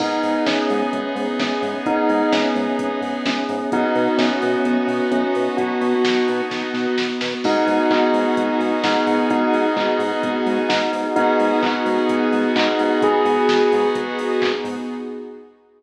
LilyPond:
<<
  \new Staff \with { instrumentName = "Tubular Bells" } { \time 4/4 \key gis \minor \tempo 4 = 129 dis'4 cis'2 cis'4 | dis'4 cis'2 cis'4 | dis'4 cis'2 cis'4 | fis'2~ fis'8 r4. |
dis'4 dis'2 dis'4 | dis'4 dis'2 dis'4 | dis'4 dis'2 dis'4 | gis'2 r2 | }
  \new Staff \with { instrumentName = "Lead 2 (sawtooth)" } { \time 4/4 \key gis \minor <b dis' gis'>1~ | <b dis' gis'>1 | <b dis' fis'>1~ | <b dis' fis'>1 |
<b dis' fis' gis'>1~ | <b dis' fis' gis'>1 | <b dis' fis' gis'>1~ | <b dis' fis' gis'>1 | }
  \new Staff \with { instrumentName = "Synth Bass 1" } { \clef bass \time 4/4 \key gis \minor gis,,8 gis,8 gis,,8 gis,8 gis,,8 gis,8 gis,,8 gis,8 | gis,,8 gis,8 gis,,8 gis,8 gis,,8 gis,8 gis,,8 gis,8 | b,,8 b,8 b,,8 b,8 b,,8 b,8 b,,8 b,8 | b,,8 b,8 b,,8 b,8 b,,8 b,8 b,,8 b,8 |
gis,,8 gis,8 gis,,8 gis,8 gis,,8 gis,8 gis,,8 gis,8 | gis,,8 gis,8 gis,,8 gis,8 gis,,8 gis,8 gis,,8 gis,8 | gis,,8 gis,8 gis,,8 gis,8 gis,,8 gis,8 gis,,8 gis,8 | gis,,8 gis,8 gis,,8 gis,8 gis,,8 gis,8 gis,,8 gis,8 | }
  \new Staff \with { instrumentName = "Pad 5 (bowed)" } { \time 4/4 \key gis \minor <b dis' gis'>1~ | <b dis' gis'>1 | <b dis' fis'>1~ | <b dis' fis'>1 |
<b dis' fis' gis'>1~ | <b dis' fis' gis'>1 | <b dis' fis' gis'>1~ | <b dis' fis' gis'>1 | }
  \new DrumStaff \with { instrumentName = "Drums" } \drummode { \time 4/4 <cymc bd>8 hho8 <bd sn>8 hho8 <hh bd>8 hho8 <bd sn>8 hho8 | <hh bd>8 hho8 <bd sn>8 hho8 <hh bd>8 hho8 <bd sn>8 hho8 | <hh bd>8 hho8 <bd sn>8 hho8 <hh bd>8 hho8 <hh bd>8 hho8 | <hh bd>8 hho8 <bd sn>8 hho8 <bd sn>8 sn8 sn8 sn8 |
<cymc bd>8 hho8 <hc bd>8 hho8 <hh bd>8 hho8 <bd sn>8 hho8 | <hh bd>8 hho8 <hc bd>8 hho8 <hh bd>8 hho8 <bd sn>8 hho8 | <hh bd>8 hho8 <hc bd>8 hho8 <hh bd>8 hho8 <hc bd>8 hho8 | <hh bd>8 hho8 <bd sn>8 hho8 <hh bd>8 hho8 <hc bd>8 hho8 | }
>>